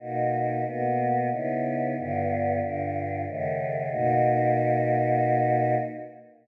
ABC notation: X:1
M:3/4
L:1/8
Q:1/4=92
K:Bmix
V:1 name="Choir Aahs"
[B,,^A,DF]2 [B,,A,B,F]2 [C,B,DE]2 | [=G,,=D,B,=F]2 [G,,D,=DF]2 [^F,,C,^D,A,]2 | [B,,^A,DF]6 |]